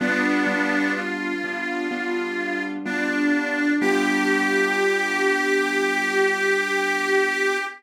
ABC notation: X:1
M:4/4
L:1/8
Q:1/4=63
K:G
V:1 name="Harmonica"
[B,D]2 =F4 D2 | G8 |]
V:2 name="Acoustic Grand Piano"
[G,B,D=F] [G,B,DF]2 [G,B,DF] [G,B,DF]2 [G,B,DF]2 | [G,B,D=F]8 |]